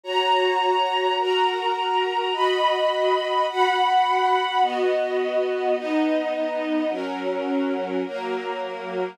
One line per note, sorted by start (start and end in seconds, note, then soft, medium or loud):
0.03 1.17 F#4 medium
0.03 1.17 C#5 medium
0.03 1.17 A#5 medium
1.19 2.32 F#4 medium
1.19 2.32 A#4 medium
1.19 2.32 A#5 medium
2.33 3.46 F#4 medium
2.33 3.46 D#5 medium
2.33 3.46 B5 medium
3.49 4.62 F#4 medium
3.49 4.62 F#5 medium
3.49 4.62 B5 medium
4.62 5.75 B3 medium
4.62 5.75 F#4 medium
4.62 5.75 D#5 medium
5.77 6.90 B3 medium
5.77 6.90 D#4 medium
5.77 6.90 D#5 medium
6.90 8.03 F#3 medium
6.90 8.03 C#4 medium
6.90 8.03 A#4 medium
8.06 9.18 F#3 medium
8.06 9.18 A#3 medium
8.06 9.18 A#4 medium